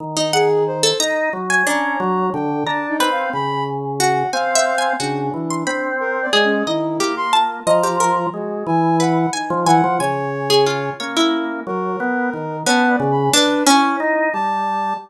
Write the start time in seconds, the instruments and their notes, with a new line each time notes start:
0.00 drawbar organ D#3
0.17 orchestral harp D#4
0.33 ocarina G#4, orchestral harp F#5
0.67 ocarina C5
0.83 orchestral harp A4
1.00 drawbar organ D#4, orchestral harp A#5
1.33 drawbar organ F#3
1.50 orchestral harp G#5
1.67 drawbar organ C#4, orchestral harp D4, ocarina A#5
2.00 drawbar organ F#3
2.33 drawbar organ D3, ocarina G5
2.67 drawbar organ D4, ocarina A5, orchestral harp A#5
2.89 ocarina D#4
3.00 drawbar organ C4, orchestral harp B4
3.11 ocarina F5
3.33 drawbar organ C#3, ocarina B5
4.00 orchestral harp F#4, ocarina F#5
4.33 drawbar organ C4, ocarina F5, orchestral harp G#5
4.55 orchestral harp E5
4.78 orchestral harp G#5
5.00 drawbar organ C#3, ocarina D4, orchestral harp F#4
5.34 drawbar organ E3
5.50 orchestral harp C6
5.67 drawbar organ C4, orchestral harp B5
6.00 ocarina A#4
6.22 ocarina D5
6.33 drawbar organ G#3, orchestral harp G#4
6.44 ocarina C#4
6.67 drawbar organ D#3, ocarina E4, orchestral harp D#5
7.00 drawbar organ A#3, orchestral harp G4
7.17 ocarina C6
7.33 ocarina F4, orchestral harp A5
7.67 drawbar organ F3, orchestral harp D#5, ocarina A#5
7.83 orchestral harp G4
8.00 orchestral harp A#4
8.33 drawbar organ G#3, ocarina F#4
8.67 drawbar organ E3, ocarina G#5
9.00 orchestral harp B4, ocarina F#5
9.33 ocarina D#4, orchestral harp G#5
9.50 drawbar organ F3
9.66 drawbar organ E3, ocarina F#5, orchestral harp G#5
9.84 drawbar organ F3
10.00 drawbar organ C#3, ocarina C#5, orchestral harp G#5
10.50 orchestral harp G#4
10.66 orchestral harp F4
11.00 drawbar organ A#3, ocarina C#4, orchestral harp C#5
11.17 orchestral harp E4
11.67 drawbar organ F#3, ocarina A#4
12.00 drawbar organ B3
12.33 drawbar organ D#3
12.66 drawbar organ B3, orchestral harp C#4, ocarina A5
12.89 ocarina D5
13.00 drawbar organ C#3
13.11 ocarina B5
13.33 orchestral harp D4, ocarina B4
13.67 orchestral harp C#4, ocarina E4
14.00 drawbar organ D#4
14.33 drawbar organ G3, ocarina A5